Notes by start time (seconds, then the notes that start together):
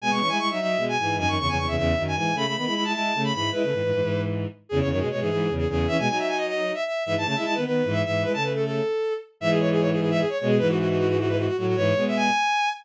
0.01 B2 G#3 G#5
0.10 B2 G#3 C#6
0.20 E3 C#4 C#6
0.29 G#3 E4 G#5
0.39 G#3 E4 C#6
0.50 F#3 D#4 E5
0.59 F#3 D#4 E5
0.77 B2 G#3
0.89 G#5
0.98 G#2 E3 G#5
1.17 F#2 D#3 G#5
1.27 F#2 D#3 C#6
1.39 E2 C#3 C#6
1.48 E2 C#3 G#5
1.57 E2 C#3 C#6
1.67 E2 C#3 E5
1.76 E2 C#3 E5
1.97 F#2 D#3
2.07 G#5
2.15 G#2 E3 G#5
2.35 C#3 A3 B5
2.45 C#3 A3 B5
2.56 D#3 B3 B5
2.65 G#3 E4 B5
2.74 G#3 E4 B5
2.84 G#3 E4 A5
2.93 G#3 E4 A5
3.14 C#3 A3
3.24 B5
3.33 G#2 E3 B5
3.52 G#3 E4 B4
3.63 C#3 A3
3.72 G#2 E3
3.83 G#2 E3
3.92 G#2 E3
4.01 G#2 E3
4.69 E2 C#3 G#4
4.80 E2 C#3 C#5
4.90 F#2 D#3 C#5
4.99 B2 G#3 G#4
5.11 B2 G#3 C#5
5.20 G#2 E3 G#4
5.29 G#2 E3 G#4
5.49 E2 C#3
5.58 G#4
5.68 E2 C#3 G#4
5.88 E3 C#4 E5
5.98 B2 G#3 G#5
6.08 F#3 D#4 G#5
6.19 E5
6.28 G#5
6.37 D#5
6.47 D#5
6.74 E5
6.86 E5
7.05 G#2 E3 E5
7.15 G#2 E3 A5
7.25 C#3 A3 A5
7.36 G#3 E4 E5
7.45 G#3 E4 A5
7.54 D#3 B3 B4
7.65 D#3 B3 B4
7.84 G#2 E3
7.92 E5
8.05 G#2 E3 E5
8.23 G#3 E4 B4
8.34 C#3 A3 A5
8.43 B4
8.54 A4
8.65 A4
9.40 G#2 E3 E5
9.50 G#4
9.60 C#5
9.71 G#4
9.80 C#5
9.92 G#4
10.00 G#4
10.10 E5
10.19 G#4
10.29 C#5
10.39 B2 G#3 C#5
10.48 G#4
10.59 G#2 E3 B4
10.69 F#4
10.79 F#4
10.89 F#4
10.98 F#4
11.08 F#4
11.19 F#4
11.28 B4
11.38 F#4
11.47 F#4
11.57 A2 F#3 F#4
11.67 F#4
11.76 G#2 E3 C#5
11.96 B2 G#3
12.08 E5
12.17 G#5